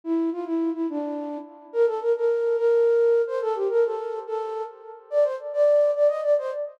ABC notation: X:1
M:6/8
L:1/8
Q:3/8=142
K:C
V:1 name="Flute"
E2 F E2 E | D4 z2 | [K:Bb] B A B B3 | B5 c |
A G B A3 | A3 z3 | [K:Gm] d c z d3 | d e d c z2 |]